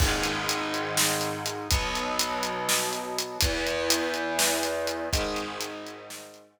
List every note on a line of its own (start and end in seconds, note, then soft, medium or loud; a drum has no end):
0.00 1.68 G#2 medium
0.00 1.68 D#3 medium
0.00 1.68 G#3 medium
0.00 kick loud
0.00 crash loud
0.23 closed hi-hat medium
0.49 closed hi-hat loud
0.74 closed hi-hat medium
0.97 snare loud
1.21 closed hi-hat medium
1.46 closed hi-hat medium
1.71 3.38 B2 medium
1.71 3.38 F#3 medium
1.71 3.38 B3 medium
1.71 kick loud
1.71 closed hi-hat loud
1.95 closed hi-hat medium
2.19 closed hi-hat loud
2.43 closed hi-hat medium
2.69 snare loud
2.93 closed hi-hat medium
3.18 closed hi-hat medium
3.41 5.09 E2 medium
3.41 5.09 E3 medium
3.41 5.09 B3 medium
3.41 kick loud
3.41 closed hi-hat loud
3.67 closed hi-hat medium
3.90 closed hi-hat loud
4.14 closed hi-hat medium
4.39 snare loud
4.63 closed hi-hat medium
4.87 closed hi-hat medium
5.13 6.60 G#2 medium
5.13 6.60 D#3 medium
5.13 6.60 G#3 medium
5.13 kick loud
5.13 closed hi-hat medium
5.36 closed hi-hat medium
5.61 closed hi-hat loud
5.87 closed hi-hat medium
6.10 snare loud
6.34 closed hi-hat medium